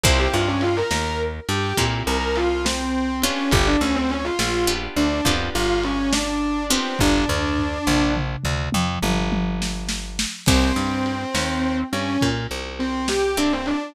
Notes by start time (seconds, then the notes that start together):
0.04 C2 A#3 C4 E4 G4 C5, kick, ride
0.19 G4
0.33 G2 F4
0.48 C#4
0.61 F4, ride
0.77 A#4
0.91 D#2, snare
1.49 G2 G4, ride
1.77 A#2 A#3 C4 E4 G4, kick, ride
2.07 C2 A#4
2.36 F4, ride
2.65 C4, snare
3.22 B3 C#4 D4 F4 G4, ride
3.51 G1 G4, kick, ride
3.67 D4
3.81 D2 C#4
3.95 C4
4.10 C#4, ride
4.24 F4
4.39 A#1, snare
4.67 B3 D4 F4 G4
4.96 D2 D4, ride
5.25 F2 B3 D4 F4 G4, kick, ride
5.55 G1 F4
5.84 C#4, ride
6.13 D4, snare
6.70 B3 C4 D4 F4 G4, ride
6.99 G1 D4, kick, floor tom
7.28 D2, floor tom
7.58 floor tom
7.87 A#1, mid tom
8.17 mid tom
8.44 D2, mid tom
8.72 F2, high tom
9.03 G1, high tom
9.32 high tom
9.62 snare
9.89 snare
10.19 snare
10.46 C2 A#3 C4 E4 G4, kick, crash
10.76 G2
11.06 ride
11.35 D#2, snare
11.93 G2 C#4, ride
12.21 A#2, kick, ride
12.51 C2
12.79 C4, ride
13.08 G4, snare
13.37 A#3 C4 D4 E4 G4
13.52 C4
13.66 D4, ride